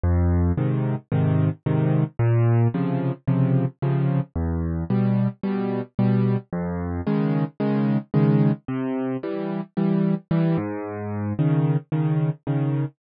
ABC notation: X:1
M:4/4
L:1/8
Q:1/4=111
K:Db
V:1 name="Acoustic Grand Piano" clef=bass
F,,2 [A,,C,E,]2 [A,,C,E,]2 [A,,C,E,]2 | B,,2 [C,D,F,]2 [C,D,F,]2 [C,D,F,]2 | =E,,2 [=B,,=G,]2 [B,,G,]2 [B,,G,]2 | F,,2 [D,E,A,]2 [D,E,A,]2 [D,E,A,]2 |
C,2 [=E,=G,]2 [E,G,]2 [E,G,] A,,- | A,,2 [D,E,]2 [D,E,]2 [D,E,]2 |]